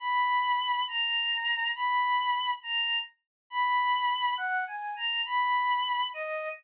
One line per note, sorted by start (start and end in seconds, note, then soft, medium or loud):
0.00 0.85 B5 loud
0.88 1.70 A#5 loud
1.75 2.52 B5 loud
2.63 2.98 A#5 loud
3.50 4.35 B5 loud
4.37 4.64 F#5 loud
4.67 4.94 G#5 loud
4.96 5.21 A#5 loud
5.25 6.07 B5 loud
6.14 6.49 D#5 loud